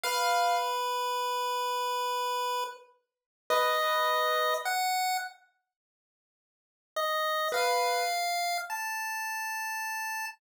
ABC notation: X:1
M:6/8
L:1/8
Q:3/8=35
K:none
V:1 name="Acoustic Grand Piano"
f z5 | B2 z4 | z B z4 |]
V:2 name="Lead 1 (square)"
B5 z | ^d2 ^f z3 | ^d f2 a3 |]